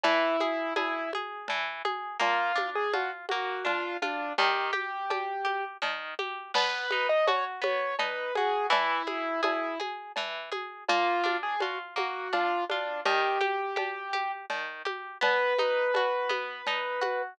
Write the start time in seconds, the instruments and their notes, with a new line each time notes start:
0.03 orchestral harp E3, acoustic grand piano E4, cowbell, low conga
0.40 orchestral harp G#4, high conga
0.76 acoustic grand piano E4, orchestral harp G#4, cowbell, high conga
1.13 orchestral harp G#4, high conga
1.48 orchestral harp E3, cowbell, low conga
1.85 orchestral harp G#4, high conga
2.19 orchestral harp A#3, acoustic grand piano F4, cowbell, low conga
2.56 orchestral harp D4, high conga
2.75 acoustic grand piano G#4
2.93 orchestral harp F4, acoustic grand piano F#4, cowbell, high conga
3.29 orchestral harp A#3, acoustic grand piano F#4, high conga
3.65 orchestral harp D4, acoustic grand piano F4, cowbell, low conga
4.02 acoustic grand piano D4, orchestral harp F4, high conga
4.38 orchestral harp D#3, acoustic grand piano G4, cowbell, low conga
4.73 orchestral harp G4, high conga
5.10 orchestral harp G4, cowbell, high conga
5.45 orchestral harp G4, high conga
5.82 orchestral harp D#3, cowbell, low conga
6.19 orchestral harp G4, high conga
6.54 orchestral harp B3, acoustic grand piano B4, crash, cowbell, low conga
6.91 orchestral harp D#4, high conga
7.09 acoustic grand piano D#5
7.27 orchestral harp F#4, acoustic grand piano C#5, cowbell, high conga
7.62 orchestral harp B3, acoustic grand piano C#5, high conga
7.99 orchestral harp D#4, acoustic grand piano B4, cowbell, low conga
8.35 orchestral harp F#4, acoustic grand piano G#4, high conga
8.70 orchestral harp E3, acoustic grand piano E4, cowbell, low conga
9.07 orchestral harp G#4, high conga
9.43 acoustic grand piano E4, orchestral harp G#4, cowbell, high conga
9.80 orchestral harp G#4, high conga
10.16 orchestral harp E3, cowbell, low conga
10.52 orchestral harp G#4, high conga
10.88 orchestral harp A#3, acoustic grand piano F4, cowbell, low conga
11.24 orchestral harp D4, high conga
11.43 acoustic grand piano G#4
11.60 orchestral harp F4, acoustic grand piano F#4, cowbell, high conga
11.96 orchestral harp A#3, acoustic grand piano F#4, high conga
12.33 orchestral harp D4, acoustic grand piano F4, cowbell, low conga
12.69 acoustic grand piano D4, orchestral harp F4, high conga
13.05 orchestral harp D#3, acoustic grand piano G4, cowbell, low conga
13.41 orchestral harp G4, high conga
13.76 orchestral harp G4, cowbell, high conga
14.13 orchestral harp G4, high conga
14.50 orchestral harp D#3, cowbell, low conga
14.85 orchestral harp G4, high conga
15.21 orchestral harp B3, acoustic grand piano B4, cowbell, low conga
15.58 orchestral harp D#4, high conga
15.94 orchestral harp F#4, cowbell, high conga
16.29 orchestral harp B3, high conga
16.67 orchestral harp D#4, cowbell, low conga
17.01 orchestral harp F#4, high conga